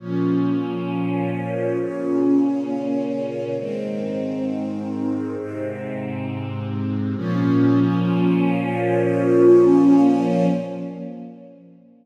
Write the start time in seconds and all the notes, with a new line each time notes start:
0.00 A#2 F3 C#4
1.79 A#2 C#3 C#4
3.58 G#2 D#3 C4
5.37 G#2 C3 C4
7.16 A#2 F3 C#4